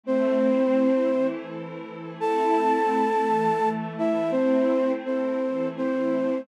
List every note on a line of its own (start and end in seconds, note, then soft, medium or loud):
0.03 1.10 A3 medium
0.03 1.10 C4 medium
0.03 1.27 C4 medium
0.03 1.10 E4 medium
0.03 1.27 C5 medium
1.12 2.18 E3 medium
1.12 2.18 A3 medium
1.12 2.18 E4 medium
2.19 3.25 A3 medium
2.19 3.25 C4 medium
2.19 3.25 E4 medium
2.19 3.69 A4 medium
2.19 3.69 A5 medium
3.26 4.32 E3 medium
3.26 4.32 A3 medium
3.26 4.32 E4 medium
3.98 4.31 E4 medium
3.98 4.31 E5 medium
4.31 5.39 A3 medium
4.31 4.92 C4 medium
4.31 5.39 C4 medium
4.31 5.39 E4 medium
4.31 4.92 C5 medium
5.06 5.68 C4 medium
5.06 5.68 C5 medium
5.41 6.47 E3 medium
5.41 6.47 A3 medium
5.41 6.47 E4 medium
5.77 6.41 C4 medium
5.77 6.41 C5 medium